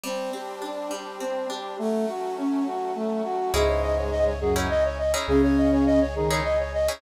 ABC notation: X:1
M:3/4
L:1/16
Q:1/4=103
K:Bm
V:1 name="Flute"
z12 | z12 | [K:C#m] G c d c d c G c d c d c | G c d c d c G c d c d c |]
V:2 name="Brass Section"
=C2 G2 D2 G2 C2 G2 | A,2 F2 C2 F2 A,2 F2 | [K:C#m] [G,,G,]6 [F,,F,]2 z4 | [C,C]6 [D,D]2 z4 |]
V:3 name="Pizzicato Strings"
G,2 =C2 D2 G,2 C2 D2 | z12 | [K:C#m] [CDEG]7 [CDEG]4 [CDEG]- | [CDEG]7 [CDEG]4 [CDEG] |]
V:4 name="Synth Bass 2" clef=bass
z12 | z12 | [K:C#m] C,,12 | C,,12 |]
V:5 name="Brass Section"
[G,=CD]12 | [F,A,C]12 | [K:C#m] [cdeg]12 | [Gcdg]12 |]